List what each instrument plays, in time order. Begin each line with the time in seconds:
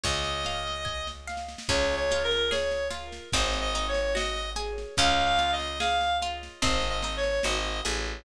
0.03 electric bass (finger) C#2, acoustic guitar (steel) C#5, clarinet D#5, kick, snare
0.23 snare
0.45 acoustic guitar (steel) F5, snare
0.67 snare
0.85 acoustic guitar (steel) G#5, kick, snare
1.07 snare
1.27 acoustic guitar (steel) F5, snare
1.37 snare
1.48 snare
1.58 snare
1.68 electric bass (finger) C#2, acoustic guitar (steel) C#4, clarinet C#5, kick, snare, crash
1.91 snare
1.96 clarinet C#5
2.11 acoustic guitar (steel) F4, snare
2.24 clarinet A#4
2.31 snare
2.51 acoustic guitar (steel) G#4, clarinet C#5, snare
2.71 snare
2.90 acoustic guitar (steel) F4, snare
3.12 snare
3.32 electric bass (finger) G#1, acoustic guitar (steel) C4, clarinet D#5, kick, snare
3.53 snare
3.61 clarinet D#5
3.74 acoustic guitar (steel) D#4, snare
3.88 clarinet C#5
3.94 snare
4.15 acoustic guitar (steel) F#4, clarinet D#5, snare
4.36 snare
4.56 acoustic guitar (steel) G#4, snare
4.78 snare
4.97 electric bass (finger) C#2, acoustic guitar (steel) C#4, clarinet F5, kick, snare
5.20 snare
5.25 clarinet F5
5.39 acoustic guitar (steel) F4, snare
5.52 clarinet D#5
5.59 snare
5.80 acoustic guitar (steel) G#4, clarinet F5, snare
6.01 snare
6.22 acoustic guitar (steel) F4, snare
6.43 snare
6.62 electric bass (finger) G#1, acoustic guitar (steel) C4, clarinet D#5, kick, snare
6.82 snare
6.89 clarinet D#5
7.02 acoustic guitar (steel) D#4, snare
7.17 clarinet C#5
7.23 snare
7.43 electric bass (finger) G#1, acoustic guitar (steel) F#4, clarinet D#5, snare
7.65 snare
7.85 electric bass (finger) A1, acoustic guitar (steel) G#4, snare
8.05 snare